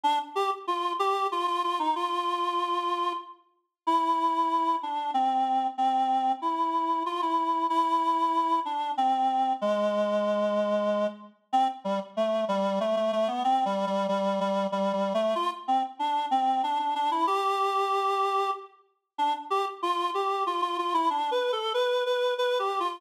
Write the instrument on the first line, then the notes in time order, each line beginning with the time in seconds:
clarinet
0.04 D4
0.35 G4
0.67 F4
0.99 G4
1.32 F4
1.47 F4
1.64 F4
1.79 D#4
1.96 F4
3.87 E4
4.83 D4
5.14 C4
5.78 C4
6.42 E4
7.06 F4
7.22 E4
7.70 E4
8.65 D4
8.97 C4
9.61 G#3
11.53 C4
11.84 G3
12.17 A3
12.48 G3
12.80 A3
12.96 A3
13.13 A3
13.28 B3
13.44 C4
13.65 G3
13.87 G3
14.08 G3
14.40 G3
14.72 G3
14.93 G3
15.14 A3
15.35 F4
15.68 C4
15.99 D4
16.31 C4
16.63 D4
16.79 D4
16.95 D4
17.11 E4
17.27 G4
19.18 D4
19.50 G4
19.82 F4
20.14 G4
20.46 F4
20.62 F4
20.78 F4
20.94 E4
21.10 D4
21.31 B4
21.52 A4
21.74 B4
22.06 B4
22.38 B4
22.59 G4
22.80 F4